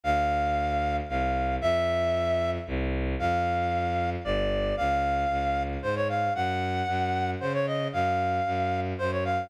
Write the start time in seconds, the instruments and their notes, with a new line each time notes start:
0.04 violin D2, clarinet F5
1.09 violin C2, clarinet F5
1.61 violin F2, clarinet E5
2.67 violin C2
3.19 violin F2, clarinet F5
4.24 violin G1, clarinet D5
4.77 violin C#2, clarinet F5
5.30 violin C#2
5.82 violin G#2, clarinet C5
5.96 clarinet C#5
6.09 clarinet F5
6.35 violin F#2, clarinet F#5
6.88 violin F#2
7.40 violin C#3, clarinet C5
7.54 clarinet C#5
7.67 clarinet D#5
7.93 violin F#2, clarinet F5
8.46 violin F#2
8.98 violin F#2, clarinet C5
9.12 clarinet C#5
9.25 clarinet F5